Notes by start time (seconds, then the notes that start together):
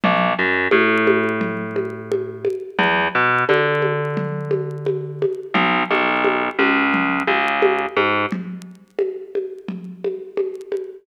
0.04 B1, low conga
0.39 F#2
0.71 A2, high conga
1.07 high conga
1.41 low conga
1.76 high conga
2.11 high conga
2.45 high conga
2.79 E2, low conga
3.15 B2
3.49 D3, high conga
3.82 high conga
4.17 low conga
4.51 high conga
4.86 high conga
5.22 high conga
5.54 B1, low conga
5.91 B1, high conga
6.24 high conga
6.59 C#2, high conga
6.94 low conga
7.27 C#2, high conga
7.62 high conga
7.96 G#2, high conga
8.32 low conga
8.99 high conga
9.35 high conga
9.68 low conga
10.04 high conga
10.37 high conga
10.72 high conga